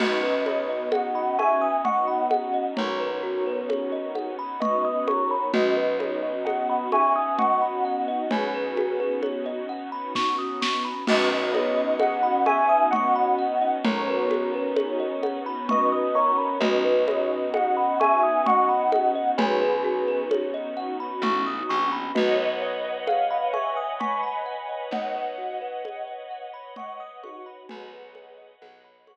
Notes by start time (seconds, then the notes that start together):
0.00 B1 B3 C#4 D#4 F#4 B4 D#5, crash, low conga
0.23 B4
0.46 B4 C#5 D#5, high conga
0.69 D#5
0.92 D#5 F#5, high conga
1.15 B5
1.38 E5 G#5 C#6, high conga
1.62 D#6
1.85 D#5 F#5 C#6, low conga
2.08 B5
2.31 F#5, high conga
2.54 D#5
2.77 B1 A#4 C#5, low conga
3.00 B4
3.23 F#4
3.46 B4
3.69 C#5, high conga
3.92 D#5
4.15 F#5, high conga
4.39 B5
4.60 B4 D#5 C#6, low conga
4.85 D#6
5.08 A#4 C#5 C#6, high conga
5.31 B5
5.53 B1 B3 C#4 D#4 F#4 B4 D#5, low conga
5.77 B4
5.99 B4 C#5 D#5, high conga
6.23 D#5
6.45 D#5 F#5, high conga
6.69 B5
6.92 E5 G#5 C#6, high conga
7.16 D#6
7.39 D#5 F#5 C#6, low conga
7.62 B5
7.85 F#5
8.08 D#5
8.31 B1 G#4 B4 C#5, low conga
8.54 B4
8.77 F#4, high conga
9.00 B4
9.23 C#5, high conga
9.46 D#5
9.69 F#5
9.92 B5
10.15 C#6, kick, snare
10.38 D#6
10.62 C#6, snare
10.85 B5
11.07 B1 B3 C#4 D#4 F#4 B4 D#5, crash, low conga
11.31 B4
11.53 B4 C#5 D#5, high conga
11.77 D#5
12.00 D#5 F#5, high conga
12.23 B5
12.46 E5 G#5 C#6, high conga
12.69 D#6
12.91 D#5 F#5 C#6, low conga
13.16 B5
13.39 F#5
13.62 D#5
13.84 B1 A#4 C#5, low conga
14.08 B4
14.30 F#4, high conga
14.54 B4
14.76 C#5, high conga
15.00 D#5
15.23 F#5, high conga
15.46 B5
15.69 B4 D#5 C#6, low conga
15.92 D#6
16.15 A#4 C#5 C#6
16.38 B5
16.60 B1 B3 C#4 D#4 F#4 B4 D#5, low conga
16.85 B4
17.08 B4 C#5 D#5, high conga
17.31 D#5
17.54 D#5 F#5, high conga
17.77 B5
18.00 E5 G#5 C#6, high conga
18.23 D#6
18.46 D#5 F#5 C#6, low conga
18.69 B5
18.92 F#5, high conga
19.15 D#5
19.38 B1 G#4 B4 C#5, low conga
19.61 B4
19.84 F#4
20.08 B4
20.31 C#5, high conga
20.54 D#5
20.77 F#5
21.00 B5
21.22 A1 C#6, low conga
21.46 D#6
21.69 A#1 C#6
21.92 B5
22.14 B1 F#4 B4 C#5 D#5 F#5, low conga
22.38 B4
22.62 B4 C#5 D#5
22.84 D#5
23.07 F5 F#5, high conga
23.31 B5
23.53 E5 G#5 C#6, high conga
23.77 D#6
24.00 G#5 B5 C#6, low conga
24.23 B5
24.46 F#5
24.69 D#5
24.91 B1 C#5 D#5 F#5, low conga
25.15 B4
25.38 F#4
25.61 B4
25.85 C#5, high conga
26.08 D#5
26.31 F#5
26.54 B5
26.76 D#5 F#5 C#6, low conga
27.00 D#6
27.23 D#4 F#4 C#6, high conga
27.46 B5
27.68 B1 F#4 G#4 B4 C#5 D#5 F#5, low conga
27.92 B4
28.15 C#5, high conga
28.38 D#5
28.62 B1 F#5, high conga
28.84 B5
29.07 C#6, high conga